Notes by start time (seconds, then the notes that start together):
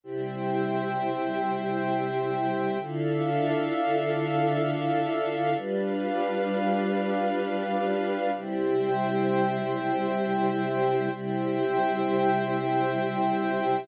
0.03 C3 G3 E4 C5 E5 G5
2.80 D3 D4 E4 F4 A4 E5 F5
5.57 G3 D4 F4 B4 F5
8.34 C3 G3 E4 C5 E5 G5
11.11 C3 G3 E4 C5 E5 G5